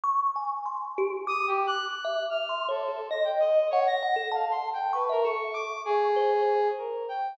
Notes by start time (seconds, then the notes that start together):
0.04 C#6
0.36 G#5
0.66 C6
0.98 G4
1.27 D6 D#6
1.47 G4
1.67 F#6
1.86 F#6
2.04 E5
2.30 F6
2.49 C6
2.68 A4 C#5
2.88 A4
3.11 D#5 A#6
3.24 G5
3.40 D#5
3.71 C#5 F#5
3.87 A#6
4.03 F#5
4.16 A4
4.32 F5 A5
4.51 C6
4.73 G5
4.93 B4 C#6
5.09 A#4 E5
5.24 A4 C#6
5.53 C#6 D6
5.85 G#4
6.16 C5
6.78 A#4
7.09 G5